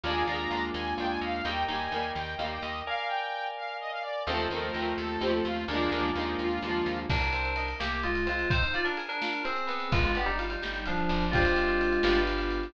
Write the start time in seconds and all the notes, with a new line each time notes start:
0.04 D#2 G#3 A#3 D4 F4 G#5
0.08 G#3 A#3
0.27 D#2 D4 F4 A#5
0.32 G#3 A#3
0.51 D#2 D4 F4
0.55 G#3 A#3
0.74 D#2 G#5
0.98 D#2 D4 F4 G5
1.02 G#3 A#3
1.09 G#5
1.21 D#2 F5
1.43 D#2 D#4 A#4 D#5 G5
1.47 G3 A#3
1.68 D#2 A#3 D#4 G#5
1.73 G3
1.92 D#2 A#3 D#4
1.96 G3
2.15 D#2 G5
2.38 D#2 A#3 D#4 F5
2.44 G3
2.51 G5
2.62 D#2 D#5
2.87 A#4 D5 F5 G#5
3.07 G5
3.57 F5
3.80 D#5
3.92 F5
4.02 D5
4.26 D#2 A3 C4 D#4 F4 A4
4.32 F3 A3
4.50 D#2 C4 D#4 A#4
4.55 F3 A3
4.74 D#2 C4 D#4
4.79 F3 A3
4.98 D#2 A4
5.20 D#2 C4 D#4 G4
5.25 F3 A3
5.33 A4
5.45 D#2 F4
5.68 D#2 G#3 A#3 D4 F4
5.73 F3 G#3
5.92 D#2 A#3 D4
5.96 F3 G#3
6.14 D#2 A#3 D4 D#4
6.20 F3 G#3
6.39 D#2 F4
6.62 D#2 A#3 D4
6.67 F3 G#3
6.86 D#2
7.09 C2 A#3 D4 A#4, kick, crash
7.22 ride
7.33 C4, ride
7.45 ride
7.56 D#4, ride
7.68 ride
7.80 C2 A#3 G4, snare
7.92 ride
8.03 G#3 D#4 F4, ride
8.15 ride
8.26 G#3 C4 F4, ride
8.39 ride
8.50 C4 D#4 C5, kick, ride
8.62 D#4 C5, ride
8.73 F4 D5, ride
8.85 D4 A#4, ride
8.97 G#4, ride
9.09 D4 A#4, ride
9.22 F4, snare
9.33 ride
9.44 C4 G#4, ride
9.56 ride
9.67 B3, ride
9.80 ride
9.92 G1 G#3 F4, kick, ride
10.04 G#3 F4, ride
10.14 B3 D4 G4, ride
10.26 G3 D#4, ride
10.39 F4, ride
10.50 G3 D#4, ride
10.62 G1 G4, snare
10.75 ride
10.86 F3 D4 F4, ride
10.98 ride
11.09 G1 D4, ride
11.21 ride
11.31 G#3 C4 D4 F4 G4, kick, ride
11.35 D4 F4
11.40 C4
11.45 ride
11.56 ride
11.68 ride
11.81 ride
11.93 ride
12.03 G1 B3 D4 F4 G4, snare
12.08 B3 D4
12.15 ride
12.27 ride
12.38 ride
12.51 ride
12.63 ride